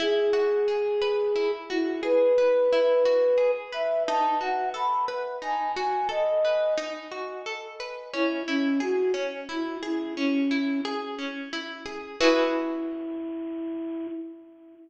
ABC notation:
X:1
M:6/8
L:1/8
Q:3/8=59
K:E
V:1 name="Flute"
G5 E | B5 e | a f b z g g | d2 z4 |
E C F z E E | C2 z4 | E6 |]
V:2 name="Orchestral Harp"
E F G B E F | G B E F G B | D F A B D F | A B D F A B |
C E G C E G | C E G C E G | [EFGB]6 |]